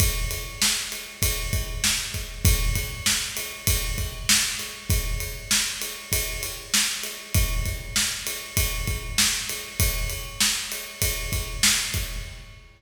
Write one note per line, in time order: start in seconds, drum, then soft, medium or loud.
0.00 kick loud
0.00 ride loud
0.31 ride medium
0.62 snare loud
0.92 ride medium
1.22 kick loud
1.22 ride loud
1.53 kick loud
1.53 ride medium
1.84 snare loud
2.14 kick medium
2.14 ride medium
2.45 kick loud
2.45 ride loud
2.76 kick medium
2.76 ride medium
3.06 snare loud
3.37 ride medium
3.67 kick loud
3.67 ride loud
3.98 kick medium
3.98 ride medium
4.29 snare loud
4.59 ride medium
4.90 kick loud
4.90 ride loud
5.20 ride medium
5.51 snare loud
5.82 ride medium
6.12 kick medium
6.12 ride loud
6.43 ride medium
6.74 snare loud
7.03 ride medium
7.34 kick loud
7.34 ride loud
7.65 kick medium
7.65 ride medium
7.96 snare loud
8.27 ride medium
8.57 kick loud
8.57 ride loud
8.87 kick loud
8.87 ride medium
9.18 snare loud
9.49 ride medium
9.80 kick loud
9.80 ride loud
10.10 ride medium
10.40 snare loud
10.72 ride medium
11.02 kick medium
11.02 ride loud
11.32 kick medium
11.32 ride medium
11.63 snare loud
11.94 kick medium
11.94 ride medium